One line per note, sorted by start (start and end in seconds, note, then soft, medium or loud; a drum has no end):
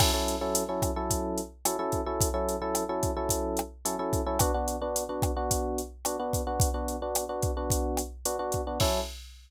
0.00 0.11 F#3 loud
0.00 0.11 C#4 medium
0.00 0.11 E4 loud
0.00 0.11 A4 loud
0.00 kick loud
0.00 cross-stick loud
0.00 crash loud
0.14 0.36 F#3 medium
0.14 0.36 C#4 medium
0.14 0.36 E4 medium
0.14 0.36 A4 medium
0.28 closed hi-hat medium
0.41 0.63 F#3 loud
0.41 0.63 C#4 medium
0.41 0.63 E4 medium
0.41 0.63 A4 medium
0.55 closed hi-hat loud
0.69 0.91 F#3 medium
0.69 0.91 C#4 medium
0.69 0.91 E4 medium
0.69 0.91 A4 medium
0.82 kick loud
0.82 cross-stick medium
0.82 closed hi-hat loud
0.96 1.40 F#3 medium
0.96 1.40 C#4 medium
0.96 1.40 E4 medium
0.96 1.40 A4 medium
1.10 kick medium
1.10 closed hi-hat loud
1.38 closed hi-hat medium
1.65 1.76 F#3 medium
1.65 1.76 C#4 medium
1.65 1.76 E4 medium
1.65 1.76 A4 medium
1.65 cross-stick loud
1.65 closed hi-hat loud
1.79 2.01 F#3 medium
1.79 2.01 C#4 medium
1.79 2.01 E4 medium
1.79 2.01 A4 loud
1.92 kick medium
1.92 closed hi-hat medium
2.06 2.28 F#3 medium
2.06 2.28 C#4 medium
2.06 2.28 E4 medium
2.06 2.28 A4 medium
2.21 kick loud
2.21 closed hi-hat loud
2.34 2.56 F#3 medium
2.34 2.56 C#4 medium
2.34 2.56 E4 medium
2.34 2.56 A4 medium
2.49 closed hi-hat medium
2.62 2.84 F#3 medium
2.62 2.84 C#4 medium
2.62 2.84 E4 medium
2.62 2.84 A4 loud
2.75 cross-stick medium
2.75 closed hi-hat loud
2.89 3.11 F#3 medium
2.89 3.11 C#4 medium
2.89 3.11 E4 medium
2.89 3.11 A4 medium
3.03 kick loud
3.03 closed hi-hat medium
3.17 3.61 F#3 medium
3.17 3.61 C#4 medium
3.17 3.61 E4 medium
3.17 3.61 A4 medium
3.29 kick medium
3.29 closed hi-hat loud
3.57 cross-stick loud
3.57 closed hi-hat medium
3.85 3.96 F#3 medium
3.85 3.96 C#4 medium
3.85 3.96 E4 medium
3.85 3.96 A4 medium
3.85 closed hi-hat loud
3.99 4.21 F#3 medium
3.99 4.21 C#4 medium
3.99 4.21 E4 medium
3.99 4.21 A4 medium
4.13 kick loud
4.13 closed hi-hat medium
4.26 4.38 F#3 medium
4.26 4.38 C#4 medium
4.26 4.38 E4 loud
4.26 4.38 A4 medium
4.39 4.51 B3 loud
4.39 4.51 D4 loud
4.39 4.51 F#4 loud
4.39 kick loud
4.39 cross-stick loud
4.39 closed hi-hat loud
4.54 4.76 B3 medium
4.54 4.76 D4 medium
4.54 4.76 F#4 medium
4.68 closed hi-hat medium
4.82 5.04 B3 medium
4.82 5.04 D4 loud
4.82 5.04 F#4 medium
4.96 closed hi-hat loud
5.09 5.31 B3 medium
5.09 5.31 D4 medium
5.09 5.31 F#4 medium
5.22 kick loud
5.22 cross-stick loud
5.22 closed hi-hat medium
5.37 5.81 B3 medium
5.37 5.81 D4 medium
5.37 5.81 F#4 loud
5.51 kick medium
5.51 closed hi-hat loud
5.78 closed hi-hat medium
6.05 6.16 B3 medium
6.05 6.16 D4 medium
6.05 6.16 F#4 medium
6.05 cross-stick loud
6.05 closed hi-hat loud
6.19 6.42 B3 loud
6.19 6.42 D4 medium
6.19 6.42 F#4 medium
6.33 kick loud
6.33 closed hi-hat loud
6.47 6.69 B3 medium
6.47 6.69 D4 medium
6.47 6.69 F#4 medium
6.60 kick loud
6.60 closed hi-hat loud
6.74 6.96 B3 medium
6.74 6.96 D4 medium
6.74 6.96 F#4 medium
6.88 closed hi-hat medium
7.02 7.24 B3 medium
7.02 7.24 D4 medium
7.02 7.24 F#4 medium
7.15 cross-stick loud
7.15 closed hi-hat loud
7.29 7.51 B3 medium
7.29 7.51 D4 medium
7.29 7.51 F#4 medium
7.42 kick loud
7.42 closed hi-hat medium
7.57 8.01 B3 medium
7.57 8.01 D4 medium
7.57 8.01 F#4 medium
7.70 kick loud
7.70 closed hi-hat loud
7.97 cross-stick loud
7.97 closed hi-hat loud
8.25 8.37 B3 medium
8.25 8.37 D4 medium
8.25 8.37 F#4 medium
8.25 closed hi-hat loud
8.39 8.61 B3 medium
8.39 8.61 D4 medium
8.39 8.61 F#4 loud
8.52 kick medium
8.52 closed hi-hat medium
8.67 8.78 B3 medium
8.67 8.78 D4 medium
8.67 8.78 F#4 medium
8.80 9.00 F#3 medium
8.80 9.00 C#4 loud
8.80 9.00 E4 loud
8.80 9.00 A4 medium
8.80 kick loud
8.80 crash loud